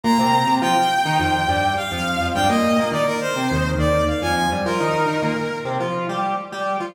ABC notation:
X:1
M:4/4
L:1/16
Q:1/4=104
K:Eb
V:1 name="Brass Section"
b4 g8 f4 | g e3 d B c4 d2 f a a z | B8 z8 |]
V:2 name="Lead 1 (square)"
[B,,B,] [C,C]2 [C,C] [F,F] z2 [E,E] [F,,F,]2 [G,,G,]2 z [F,,F,]2 [F,,F,] | [G,,G,] [B,,B,]2 [B,,B,] [E,E] z2 [C,C] [E,,E,]2 [E,,E,]2 z [F,,F,]2 [G,,G,] | [F,F] [E,E]2 [E,E] [B,,B,] z2 [C,C] [F,F]2 [G,G]2 z [G,G]2 [F,F] |]